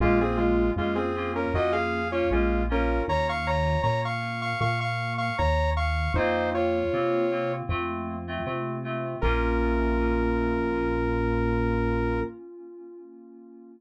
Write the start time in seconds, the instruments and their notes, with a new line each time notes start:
0.00 synth bass 1 A#1, lead 2 (sawtooth) G#3 F4, electric piano 2 A#3 C#4 F4
0.21 lead 2 (sawtooth) C4 G#4
0.37 lead 2 (sawtooth) G#3 F4
0.76 synth bass 1 F2, lead 2 (sawtooth) G#3 F4, electric piano 2 A#3 C#4 F4
0.95 lead 2 (sawtooth) C4 G#4
1.16 electric piano 2 A#3 C#4 F4
1.35 lead 2 (sawtooth) C#4 A#4
1.54 synth bass 1 F2, electric piano 2 A#3 C#4 F4, lead 2 (sawtooth) F#4 D#5
1.72 lead 2 (sawtooth) G#4 F5
2.11 electric piano 2 A#3 C#4 F4, lead 2 (sawtooth) F4 C#5
2.31 synth bass 1 A#1, lead 2 (sawtooth) G#3 F4, electric piano 2 A#3 C#4 F4
2.69 electric piano 2 A#3 C#4 F4, lead 2 (sawtooth) C#4 A#4
3.08 synth bass 1 D#2, lead 2 (sawtooth) C#5 A#5
3.29 lead 2 (sawtooth) F5 C#6
3.47 lead 2 (sawtooth) C#5 A#5
3.83 synth bass 1 A#2, lead 2 (sawtooth) C#5 A#5
4.05 lead 2 (sawtooth) F5 C#6
4.42 lead 2 (sawtooth) F5 C#6
4.61 synth bass 1 A#2, lead 2 (sawtooth) F5 C#6
4.80 lead 2 (sawtooth) F5 C#6
5.18 lead 2 (sawtooth) F5 C#6
5.38 synth bass 1 D#2, lead 2 (sawtooth) C#5 A#5
5.77 lead 2 (sawtooth) F5 C#6
6.14 synth bass 1 F2, electric piano 2 A#3 C4 F4, lead 2 (sawtooth) D#4 C5
6.54 lead 2 (sawtooth) F4 C#5
6.93 synth bass 1 C3, electric piano 2 A#3 C4 F4
7.31 electric piano 2 A#3 C4 F4
7.69 synth bass 1 F2, electric piano 2 A3 C4 F4
8.28 electric piano 2 A3 C4 F4
8.45 synth bass 1 C3, electric piano 2 A3 C4 F4
8.84 electric piano 2 A3 C4 F4
9.21 synth bass 1 A#1, electric piano 2 A#3 C#4 F4, lead 2 (sawtooth) A#4